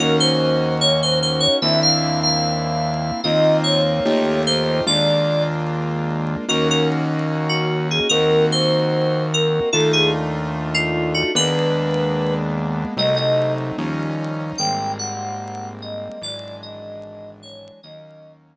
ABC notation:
X:1
M:2/2
L:1/8
Q:1/2=74
K:Ebdor
V:1 name="Electric Piano 2"
B c3 d c c d | =e f2 f5 | e2 d4 c2 | =d3 z5 |
B B z3 G2 A | B2 c4 B2 | =A _A z3 F2 G | _c5 z3 |
e e2 z5 | =g2 _g4 e2 | =d2 e4 _d2 | e3 z5 |]
V:2 name="Acoustic Grand Piano"
[B,DEG]8 | [B,C=D=E]8 | [B,CEF]4 [=A,EF=G]4 | [A,B,=DF]8 |
[B,DEG]8 | [B,CEG]8 | [=A,=DEF]8 | [A,B,_C=D]8 |
[G,=A,CE]4 [F,=G,DE]4 | [=G,A,B,C]8 | [=E,^F,^G,=D]8 | [E,G,B,D]8 |]
V:3 name="Synth Bass 1" clef=bass
E,,8 | E,,8 | E,,4 E,,4 | E,,8 |
E,,8 | E,,8 | E,,8 | E,,8 |
C,,4 E,,4 | A,,,8 | ^G,,,8 | E,,8 |]